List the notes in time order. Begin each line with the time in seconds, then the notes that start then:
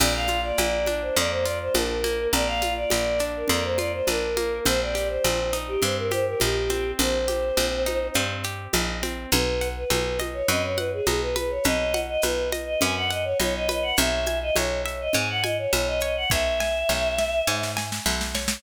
0.00 A#1 A#3 D5, crash, low conga, shaker
0.14 F5
0.27 F4, high conga, shaker
0.44 D5
0.58 A#1 A#3, high conga, shaker
0.86 D4, high conga, shaker
1.02 C5
1.16 F2 A#3 D5, low conga, shaker
1.31 C5
1.44 F4 D5, shaker
1.62 C5
1.74 A#1 D4 A#4, high conga, shaker
2.04 A#3, high conga, shaker
2.33 A#1 A#3 D5, low conga, shaker
2.46 F5
2.62 F4, high conga, shaker
2.76 D5
2.90 A#1 A#3, high conga, shaker
3.19 D4, shaker
3.36 A#4
3.48 F2 A#3 D5, low conga, shaker
3.64 C5
3.78 F4 D5, high conga, shaker
3.94 C5
4.07 A#1 D4 A#4, high conga, shaker
4.37 A#3, high conga, shaker
4.65 A#1 C4 C5, low conga, shaker
4.81 D5
4.95 G4, shaker
5.09 C5
5.24 A#1 C4, high conga, shaker
5.53 D#4, shaker
5.68 G4
5.82 G2 C4 C5, low conga, shaker
5.98 A#4
6.11 G4 C5, high conga, shaker
6.27 A#4
6.40 A#1 D#4 G4, high conga, shaker
6.70 C4, high conga, shaker
6.99 A#1 C4 C5, low conga, shaker
7.28 G4, high conga, shaker
7.57 A#1 C4, high conga, shaker
7.86 D#4, high conga, shaker
8.14 G2 C4, low conga, shaker
8.44 G4, shaker
8.73 A#1 D#4, high conga, shaker
9.03 C4, high conga, shaker
9.31 B1 B4, low conga, shaker
9.61 F#5, shaker
9.76 B4
9.90 B1 B4, high conga, shaker
10.19 D#5, high conga, shaker
10.34 C#5
10.48 F#2 B4 D#5, low conga, shaker
10.63 C#5
10.77 B4 F#5, high conga, shaker
10.93 G#4
11.06 B1 G#4 D#5, high conga, shaker
11.21 B4
11.36 B4, high conga, shaker
11.50 C#5
11.64 B1 B4 D#5, low conga, shaker
11.94 F#5, high conga, shaker
12.08 D#5
12.22 B1 B4, high conga, shaker
12.52 D#5, high conga, shaker
12.66 D#5
12.81 F#2 B4 G#5, low conga, shaker
12.96 F#5
13.11 D#5 F#5, shaker
13.24 C#5
13.40 B1 C#5 D#5, high conga, shaker
13.56 D#5
13.69 B4 D#5, high conga, shaker
13.82 F#5
13.96 B1 C#5 E5, low conga, shaker
14.26 G#5, high conga, shaker
14.42 D#5
14.56 B1 C#5, high conga, shaker
14.86 E5, shaker
15.01 D#5
15.13 G#2 C#5 G#5, low conga, shaker
15.29 F#5
15.43 D#5 G#5, high conga, shaker
15.58 C#5
15.73 B1 C#5 E5, high conga, shaker
15.87 D#5
16.00 C#5 D#5, shaker
16.16 F#5
16.30 B1 C#5 E5, kick, snare
16.60 G#5, snare
16.89 B1 C#5, snare
17.18 E5, snare
17.47 G#2 C#5, snare
17.63 snare
17.77 G#5, snare
17.92 snare
18.06 B1 E5, snare
18.21 snare
18.35 C#5, snare
18.48 snare